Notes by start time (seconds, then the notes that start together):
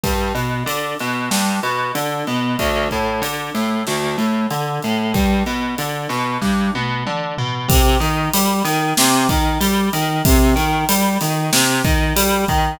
0.04 G2, kick, ride
0.35 B2, ride
0.66 D3, ride
0.99 B2, snare, ride
1.31 G2, snare
1.63 B2, ride
1.95 D3, ride
2.27 B2, ride
2.59 D2, kick, ride
2.91 A2, kick, ride
3.22 D3, ride
3.55 A2, snare, ride
3.87 D2, snare
4.18 A2, ride
4.51 D3, ride
4.82 A2, ride
5.14 G2, kick, ride
5.46 B2, ride
5.78 D3, ride
6.09 B2, snare, ride
6.41 G2, kick, snare
6.74 B2, high tom
7.06 D3, mid tom
7.38 B2, floor tom
7.68 C3, kick, ride
8.00 D#3, ride
8.34 G3, ride
8.65 D#3, snare, ride
8.97 C3, snare
9.29 D#3, kick, ride
9.61 G3, ride
9.93 D#3, ride
10.25 C3, kick, ride
10.56 D#3, ride
10.89 G3, ride
11.21 D#3, snare, ride
11.53 C3, snare
11.85 D#3, kick, ride
12.16 G3, ride
12.48 D#3, kick, ride